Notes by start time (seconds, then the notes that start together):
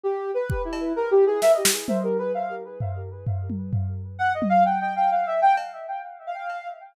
0.03 G4
0.34 B4
0.50 kick
0.65 E4
0.73 cowbell
0.96 A#4
1.11 G4
1.27 G#4
1.42 E5, snare
1.54 D#5
1.65 snare
1.88 C5, high tom
2.03 A#4
2.18 B4
2.34 F5
2.80 floor tom
3.27 floor tom
3.50 high tom
3.73 floor tom
4.19 F#5
4.34 D#5
4.42 high tom
4.50 F5
4.65 G5
4.80 G5
4.96 G5
5.11 F5
5.26 E5
5.42 G5
5.57 cowbell
6.27 F5
6.50 cowbell